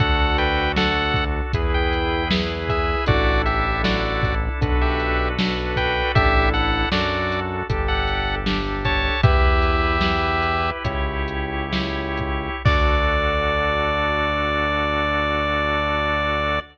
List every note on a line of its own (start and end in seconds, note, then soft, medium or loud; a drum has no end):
0.00 1.41 D2 medium
0.00 0.69 D4 loud
0.00 1.52 D4 medium
0.00 0.69 F#4 loud
0.00 1.52 F#4 medium
0.00 0.37 A4 medium
0.00 0.69 A4 medium
0.00 1.52 A4 medium
0.00 0.37 F#5 medium
0.00 kick loud
0.00 closed hi-hat medium
0.38 0.72 B4 medium
0.38 0.72 G5 medium
0.38 closed hi-hat medium
0.76 1.47 D4 loud
0.76 1.47 F#4 medium
0.76 1.25 A4 medium
0.76 1.47 A4 medium
0.76 1.25 F#5 medium
0.76 snare loud
1.14 kick medium
1.14 closed hi-hat medium
1.53 2.96 E2 medium
1.53 2.24 E4 loud
1.53 3.07 E4 loud
1.53 2.24 G#4 loud
1.53 3.07 G#4 medium
1.53 2.24 B4 loud
1.53 3.07 B4 medium
1.53 kick medium
1.53 closed hi-hat loud
1.74 2.29 G5 medium
1.93 closed hi-hat medium
2.31 3.01 E4 loud
2.31 3.01 G#4 medium
2.31 3.01 B4 loud
2.31 snare loud
2.69 3.05 G#4 medium
2.69 3.05 E5 medium
2.69 kick medium
2.69 closed hi-hat medium
3.06 4.49 A1 loud
3.06 3.76 D4 loud
3.06 4.61 D4 loud
3.06 3.76 E4 loud
3.06 4.61 E4 medium
3.06 3.42 F#4 medium
3.06 3.76 A4 loud
3.06 4.61 A4 loud
3.06 3.42 D5 medium
3.06 kick loud
3.06 closed hi-hat loud
3.46 3.82 G4 medium
3.46 3.82 E5 medium
3.46 closed hi-hat medium
3.83 4.53 D4 medium
3.83 4.53 E4 loud
3.83 4.35 F#4 medium
3.83 4.53 A4 medium
3.83 4.35 D5 medium
3.83 snare loud
4.23 kick medium
4.23 closed hi-hat medium
4.61 6.03 B1 medium
4.61 5.30 D4 loud
4.61 6.14 D4 medium
4.61 5.30 F#4 loud
4.61 6.15 F#4 loud
4.61 5.30 A4 loud
4.61 6.14 A4 medium
4.61 5.30 B4 loud
4.61 6.15 B4 medium
4.61 kick medium
4.61 closed hi-hat medium
4.81 5.29 G4 medium
4.81 5.29 E5 medium
5.00 closed hi-hat medium
5.39 6.09 D4 loud
5.39 6.09 F#4 medium
5.39 6.09 A4 medium
5.39 6.09 B4 medium
5.39 snare loud
5.76 6.12 B4 medium
5.76 6.12 G5 medium
5.76 kick medium
5.76 closed hi-hat medium
6.14 6.86 A1 loud
6.14 6.91 D4 medium
6.14 6.85 D4 loud
6.14 6.91 E4 medium
6.14 6.85 E4 loud
6.14 6.50 G4 medium
6.14 6.91 A4 medium
6.14 6.85 A4 loud
6.14 6.50 E5 loud
6.14 kick loud
6.14 closed hi-hat loud
6.54 6.89 A4 medium
6.54 6.89 F#5 medium
6.54 closed hi-hat medium
6.91 7.63 F#2 medium
6.91 7.67 D4 medium
6.91 7.62 D4 loud
6.91 7.67 F#4 medium
6.91 7.40 F#4 medium
6.91 7.62 F#4 loud
6.91 7.67 A4 medium
6.91 7.62 A4 loud
6.91 7.40 D5 medium
6.91 snare loud
7.32 closed hi-hat medium
7.69 9.11 G1 medium
7.69 9.22 D4 medium
7.69 8.39 D4 loud
7.69 9.22 G4 loud
7.69 8.39 G4 loud
7.69 9.22 A4 medium
7.69 8.39 A4 loud
7.69 kick medium
7.69 closed hi-hat loud
7.88 8.36 A4 medium
7.88 8.36 F#5 medium
8.08 closed hi-hat medium
8.46 9.16 D4 medium
8.46 9.16 G4 medium
8.46 9.16 A4 medium
8.46 snare loud
8.85 9.21 C#5 medium
8.85 9.21 A5 medium
8.85 kick medium
8.85 closed hi-hat medium
9.23 10.71 E2 medium
9.23 10.84 E4 medium
9.23 9.95 E4 loud
9.23 10.70 G4 medium
9.23 10.84 G4 medium
9.23 9.95 G4 loud
9.23 10.84 B4 medium
9.23 9.95 B4 loud
9.23 10.70 E5 medium
9.23 kick loud
9.23 closed hi-hat medium
9.62 closed hi-hat medium
10.01 10.77 E4 medium
10.01 10.77 G4 medium
10.01 10.77 B4 medium
10.01 snare loud
10.42 closed hi-hat medium
10.84 12.50 C#2 medium
10.84 12.63 E4 loud
10.84 11.64 E4 loud
10.84 12.63 G4 loud
10.84 11.64 G4 loud
10.84 12.63 C#5 medium
10.84 11.64 C#5 loud
10.84 kick medium
10.84 closed hi-hat loud
11.28 closed hi-hat medium
11.72 12.55 E4 loud
11.72 12.55 G4 medium
11.72 12.55 C#5 medium
11.72 snare loud
12.17 kick medium
12.17 closed hi-hat medium
12.65 16.60 D2 medium
12.65 16.59 D4 loud
12.65 16.60 D4 loud
12.65 16.59 F#4 loud
12.65 16.60 F#4 medium
12.65 16.59 A4 loud
12.65 16.60 A4 medium
12.65 16.60 D5 loud
12.65 kick loud
12.65 crash loud